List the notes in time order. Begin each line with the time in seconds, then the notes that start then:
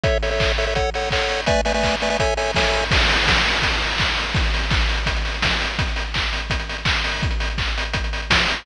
0.03 A4 C#5 E5, kick, closed hi-hat
0.22 A4 C#5 E5, open hi-hat
0.31 A4 C#5 E5
0.40 kick, clap
0.58 A4 C#5 E5, open hi-hat
0.67 A4 C#5 E5
0.75 A4 C#5 F#5, kick, closed hi-hat
0.94 A4 C#5 F#5, open hi-hat
1.11 A4 C#5 F#5, kick, clap
1.29 open hi-hat
1.46 A3 B4 D5 E5 G#5, kick, closed hi-hat
1.65 A3 B4 D5 E5 G#5, open hi-hat
1.74 A3 B4 D5 E5 G#5
1.83 kick, clap
2.00 A3 B4 D5 E5 G#5, open hi-hat
2.10 A3 B4 D5 E5 G#5
2.19 A4 C#5 E5 G#5, kick, closed hi-hat
2.37 A4 C#5 E5 G#5, open hi-hat
2.54 A4 C#5 E5 G#5, kick, snare
2.73 open hi-hat
2.91 kick, crash
3.00 closed hi-hat
3.09 open hi-hat
3.19 closed hi-hat
3.27 kick, snare
3.36 closed hi-hat
3.46 open hi-hat
3.53 closed hi-hat
3.62 kick, closed hi-hat
3.73 closed hi-hat
3.82 open hi-hat
3.91 closed hi-hat
3.98 kick, clap
4.08 closed hi-hat
4.17 open hi-hat
4.26 closed hi-hat
4.35 kick, closed hi-hat
4.44 closed hi-hat
4.54 open hi-hat
4.63 closed hi-hat
4.70 kick, clap
4.81 closed hi-hat
4.89 open hi-hat
4.97 closed hi-hat
5.06 kick, closed hi-hat
5.16 closed hi-hat
5.25 open hi-hat
5.34 closed hi-hat
5.42 kick, snare
5.51 closed hi-hat
5.61 open hi-hat
5.70 closed hi-hat
5.79 kick, closed hi-hat
5.88 closed hi-hat
5.96 open hi-hat
6.04 closed hi-hat
6.14 kick, clap
6.23 closed hi-hat
6.33 open hi-hat
6.42 closed hi-hat
6.50 kick, closed hi-hat
6.60 closed hi-hat
6.69 open hi-hat
6.78 closed hi-hat
6.85 kick, clap
6.95 closed hi-hat
7.04 open hi-hat
7.12 open hi-hat
7.23 kick, closed hi-hat
7.31 closed hi-hat
7.40 open hi-hat
7.50 closed hi-hat
7.58 kick, clap
7.67 closed hi-hat
7.78 open hi-hat
7.85 closed hi-hat
7.93 kick, closed hi-hat
8.04 closed hi-hat
8.13 open hi-hat
8.22 closed hi-hat
8.30 kick, snare
8.39 closed hi-hat
8.48 open hi-hat
8.56 closed hi-hat